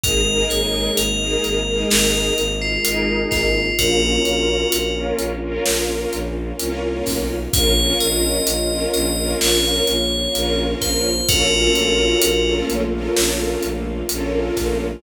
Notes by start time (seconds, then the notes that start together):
0.04 G#1 G#3 A#3 D#4 G#4 A#4, kick, closed hi-hat
0.27 D#4 G#4 A#4
0.50 G#1 C#5, closed hi-hat
0.97 G#1 A#4, closed hi-hat
1.21 D#4 G#4 A#4
1.44 G#1, closed hi-hat
1.67 D#4 G#4 A#4
1.90 G#1 A#4, snare
2.38 G#1, closed hi-hat
2.62 F4
2.85 G#1 D#4 G#4 A#4, closed hi-hat
3.31 G#1 F4, kick, snare, closed hi-hat
3.78 A#1 A#3 C#4 F4 F#4 A#4, kick, closed hi-hat
4.02 C#4 F4 A#4
4.25 A#1, closed hi-hat
4.72 A#1, closed hi-hat
4.96 C#4 F4 A#4
5.19 A#1, closed hi-hat
5.42 C#4 F4 A#4
5.66 A#1, snare
6.13 A#1, closed hi-hat
6.59 C2 C#4 F4 A#4, closed hi-hat
7.06 B1, kick, snare, open hi-hat
7.53 A#1 A#3 C#4 F4 A#4 C#5, kick, closed hi-hat
7.77 C#4 F4 A#4
8.00 A#1 D#5, closed hi-hat
8.47 A#1, closed hi-hat
8.71 C#4 F4 A#4
8.94 A#1 D#5, closed hi-hat
9.17 C#4 F4 A#4
9.41 A#1 C#5, snare
9.87 A#1, closed hi-hat
10.35 A#1 C#4 F4 A#4, closed hi-hat
10.81 A#1 C5, kick, snare, closed hi-hat
11.28 A#1 A3 A#3 C#4 F4 F#4 A4 A#4, kick, closed hi-hat
11.52 C#4 F4 A4 A#4
11.75 A#1, closed hi-hat
12.22 A#1, closed hi-hat
12.46 C#4 F4 A4 A#4
12.69 A#1, closed hi-hat
12.92 C#4 F4 A4 A#4
13.17 A#1, snare
13.62 A#1, closed hi-hat
14.09 A#1 C#4 F4 A4 A#4, closed hi-hat
14.56 A#1, kick, snare, closed hi-hat